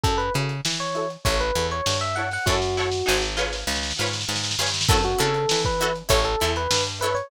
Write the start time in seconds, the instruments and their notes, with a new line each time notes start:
0.04 electric bass (finger) F#2, pizzicato strings E4 F#4 A4 C#5, electric piano 1 A4, kick, closed hi-hat
0.18 electric piano 1 B4, closed hi-hat
0.34 electric bass (finger) C#3, pizzicato strings E4 F#4 A4 C#5, closed hi-hat
0.49 closed hi-hat
0.65 electric bass (finger) E3, snare
0.80 electric piano 1 C#5, closed hi-hat
0.95 pizzicato strings E4 F#4 A4 C#5, closed hi-hat
1.10 closed hi-hat
1.25 electric bass (finger) A1, pizzicato strings E4 A4 C#5, electric piano 1 C#5, kick, closed hi-hat
1.40 electric piano 1 B4, closed hi-hat
1.55 electric bass (finger) E2, pizzicato strings E4 A4 C#5, closed hi-hat
1.71 electric piano 1 C#5, closed hi-hat
1.86 electric bass (finger) G2, snare
2.01 electric piano 1 E5, snare, closed hi-hat
2.16 pizzicato strings E4 A4 C#5, electric piano 1 F#5, closed hi-hat
2.31 electric piano 1 F#5, snare, open hi-hat
2.46 electric bass (finger) F#2, pizzicato strings E4 F#4 A4, electric piano 1 F#4, kick, snare
2.50 pizzicato strings C#5
2.62 snare
2.77 pizzicato strings E4 F#4 A4 C#5, snare
2.92 snare
3.06 electric bass (finger) G#1, pizzicato strings D#4 F#4 G#4 C5, snare
3.22 snare
3.37 pizzicato strings F4 G#4 B4 C#5, snare
3.53 snare
3.67 electric bass (finger) C#2, snare
3.76 snare
3.83 snare
3.90 snare
3.98 electric bass (finger) G#2, pizzicato strings F4 G#4 B4 C#5, snare
4.06 snare
4.13 snare
4.21 snare
4.29 electric bass (finger) G#2, snare
4.35 snare
4.44 snare
4.51 snare
4.59 electric bass (finger) G2, pizzicato strings F4 G#4 B4 C#5, snare
4.66 snare
4.74 snare
4.81 snare
4.89 electric bass (finger) F#2, pizzicato strings E4 F#4 A4 C#5, electric piano 1 A4, kick, crash
5.04 electric piano 1 F#4, closed hi-hat
5.18 electric bass (finger) C#3, pizzicato strings E4 F#4 A4 C#5, electric piano 1 A4, closed hi-hat
5.34 closed hi-hat
5.49 electric bass (finger) E3, snare
5.65 electric piano 1 B4, kick, closed hi-hat
5.80 pizzicato strings E4 F#4 A4 C#5, closed hi-hat
5.96 closed hi-hat
6.09 electric bass (finger) A1, pizzicato strings E4 A4 C#5, electric piano 1 C#5, kick, closed hi-hat
6.25 electric piano 1 A4, closed hi-hat
6.40 electric bass (finger) E2, pizzicato strings E4 A4 C#5, closed hi-hat
6.56 electric piano 1 B4, closed hi-hat
6.71 electric bass (finger) G2, snare
6.86 closed hi-hat
7.01 pizzicato strings E4 A4 C#5, electric piano 1 B4, closed hi-hat
7.15 electric piano 1 C#5, closed hi-hat